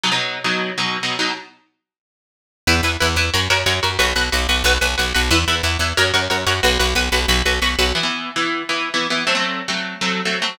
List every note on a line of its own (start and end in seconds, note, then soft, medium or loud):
0.04 0.10 B2 medium
0.04 0.10 F#3 medium
0.04 0.10 D#4 medium
0.12 0.38 B2 medium
0.12 0.38 F#3 medium
0.12 0.38 D#4 medium
0.44 0.71 B2 medium
0.44 0.71 F#3 medium
0.44 0.71 D#4 medium
0.78 0.97 B2 medium
0.78 0.97 F#3 medium
0.78 0.97 D#4 medium
1.03 1.16 B2 medium
1.03 1.16 F#3 medium
1.03 1.16 D#4 medium
1.19 1.32 B2 medium
1.19 1.32 F#3 medium
1.19 1.32 D#4 medium
2.67 2.81 E2 loud
2.67 2.74 E4 loud
2.67 2.74 B4 loud
2.83 2.97 E2 medium
2.83 2.91 E4 medium
2.83 2.91 B4 loud
3.00 3.16 E2 medium
3.00 3.07 E4 loud
3.00 3.07 B4 loud
3.16 3.30 E2 medium
3.16 3.24 E4 loud
3.16 3.24 B4 loud
3.34 3.48 F#2 medium
3.34 3.40 F#4 loud
3.34 3.40 A#4 loud
3.34 3.40 C#5 loud
3.50 3.64 F#2 medium
3.50 3.57 F#4 loud
3.50 3.57 A#4 loud
3.50 3.57 C#5 loud
3.66 3.80 F#2 medium
3.66 3.73 F#4 loud
3.66 3.73 A#4 loud
3.66 3.73 C#5 loud
3.83 3.98 F#2 medium
3.83 3.89 F#4 loud
3.83 3.89 A#4 loud
3.83 3.89 C#5 loud
3.99 4.13 B1 loud
3.99 4.05 F#4 loud
3.99 4.05 B4 loud
4.16 4.30 B1 medium
4.16 4.23 F#4 loud
4.16 4.23 B4 medium
4.32 4.47 B1 medium
4.32 4.39 F#4 loud
4.32 4.39 B4 loud
4.49 4.63 B1 medium
4.49 4.56 F#4 loud
4.49 4.56 B4 loud
4.64 4.78 B1 loud
4.64 4.72 F#4 loud
4.64 4.72 B4 loud
4.81 4.96 B1 medium
4.81 4.88 F#4 medium
4.81 4.88 B4 loud
4.98 5.13 B1 medium
4.98 5.04 F#4 medium
4.98 5.04 B4 medium
5.14 5.30 B1 medium
5.14 5.21 F#4 loud
5.14 5.21 B4 loud
5.31 5.45 E2 loud
5.31 5.38 E4 loud
5.31 5.38 B4 loud
5.48 5.62 E2 medium
5.48 5.54 E4 loud
5.48 5.54 B4 loud
5.63 5.77 E2 medium
5.63 5.70 E4 loud
5.63 5.70 B4 loud
5.79 5.93 E2 medium
5.79 5.87 E4 medium
5.79 5.87 B4 medium
5.97 6.12 F#2 loud
5.97 6.04 F#4 loud
5.97 6.04 A#4 loud
5.97 6.04 C#5 loud
6.14 6.28 F#2 medium
6.14 6.20 F#4 loud
6.14 6.20 A#4 loud
6.14 6.20 C#5 loud
6.30 6.45 F#2 medium
6.30 6.37 F#4 medium
6.30 6.37 A#4 loud
6.30 6.37 C#5 loud
6.47 6.61 F#2 medium
6.47 6.53 F#4 loud
6.47 6.53 A#4 medium
6.47 6.53 C#5 loud
6.63 6.78 B1 loud
6.63 6.70 F#4 loud
6.63 6.70 B4 loud
6.79 6.94 B1 medium
6.79 6.86 F#4 loud
6.79 6.86 B4 loud
6.95 7.09 B1 medium
6.95 7.03 F#4 medium
6.95 7.03 B4 loud
7.12 7.26 B1 medium
7.12 7.19 F#4 medium
7.12 7.19 B4 loud
7.28 7.42 B1 loud
7.28 7.36 F#4 loud
7.28 7.36 B4 loud
7.46 7.60 B1 medium
7.46 7.52 F#4 loud
7.46 7.52 B4 loud
7.62 7.76 B1 medium
7.62 7.69 F#4 loud
7.62 7.69 B4 loud
7.79 7.93 B1 medium
7.79 7.85 F#4 loud
7.79 7.85 B4 loud
7.95 8.02 E3 medium
7.95 8.02 B3 loud
7.95 8.02 E4 medium
8.03 8.30 E3 medium
8.03 8.30 B3 medium
8.03 8.30 E4 medium
8.36 8.62 E3 medium
8.36 8.62 B3 medium
8.36 8.62 E4 medium
8.69 8.89 E3 medium
8.69 8.89 B3 medium
8.69 8.89 E4 medium
8.94 9.07 E3 medium
8.94 9.07 B3 medium
8.94 9.07 E4 medium
9.10 9.24 E3 medium
9.10 9.24 B3 medium
9.10 9.24 E4 medium
9.27 9.33 F#3 medium
9.27 9.33 A3 loud
9.27 9.33 C4 loud
9.35 9.61 F#3 medium
9.35 9.61 A3 medium
9.35 9.61 C4 medium
9.68 9.95 F#3 medium
9.68 9.95 A3 medium
9.68 9.95 C4 medium
10.01 10.21 F#3 medium
10.01 10.21 A3 medium
10.01 10.21 C4 medium
10.25 10.39 F#3 medium
10.25 10.39 A3 medium
10.25 10.39 C4 medium
10.42 10.55 F#3 medium
10.42 10.55 A3 medium
10.42 10.55 C4 medium